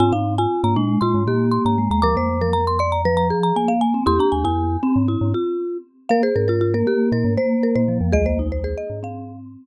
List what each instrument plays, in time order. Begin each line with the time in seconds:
0.00 glockenspiel G#2, vibraphone C4, marimba F4 G#5
0.13 glockenspiel G#2, marimba D#4 F5
0.38 marimba F4 G#5
0.64 glockenspiel G#2, vibraphone A#3, marimba A#5
0.76 glockenspiel A#2, vibraphone G#3, marimba D4
1.01 glockenspiel A#2, marimba F4 C6
1.14 glockenspiel G#2
1.27 glockenspiel A#2, vibraphone A#3, marimba G4
1.51 marimba C6
1.65 glockenspiel G#2, marimba A#5
1.78 vibraphone G#3
1.91 glockenspiel D#2, marimba A#5
2.02 glockenspiel D2, vibraphone F3, marimba A#4 A#5 D6
2.16 glockenspiel F2, vibraphone A#3, marimba C5
2.41 vibraphone F3, marimba A#4
2.53 marimba A#5
2.67 marimba C6
2.79 marimba D5 C6
2.92 marimba A#5
3.05 vibraphone F3, marimba B4
3.17 marimba A#5
3.30 marimba G#4
3.43 marimba A#5
3.56 vibraphone A#3, marimba G#5
3.68 vibraphone A#3, marimba F5
3.81 marimba G#5
3.94 vibraphone C4
4.06 glockenspiel E2, marimba E4 C6, vibraphone G4
4.19 marimba D4 A#5
4.32 glockenspiel D#2, marimba G#5
4.44 glockenspiel F2, marimba E4 G#5
4.83 marimba C4, vibraphone C4
4.96 glockenspiel G#2
5.08 marimba E4
5.21 glockenspiel G#2
5.34 marimba F4
6.09 vibraphone A#3, marimba A#4 F5
6.23 marimba G#4 C5
6.36 glockenspiel G#2, marimba A#4
6.48 marimba F4 A#4
6.61 marimba F4
6.74 vibraphone A#3, marimba A#4
6.86 vibraphone A#3, marimba G4
7.12 glockenspiel A#2, marimba A#4
7.25 glockenspiel G#2
7.37 vibraphone A#3, marimba C5
7.63 marimba A#4
7.75 glockenspiel A#2, marimba C5
7.88 vibraphone F3
8.01 glockenspiel F2
8.12 glockenspiel C2 D#2, vibraphone G#3, marimba G#4 D#5
8.26 vibraphone A#3, marimba C5
8.39 vibraphone D#4
8.52 marimba C5
8.64 marimba G#4 C5
8.78 marimba D#5
8.90 glockenspiel G#2
9.03 vibraphone C4, marimba F5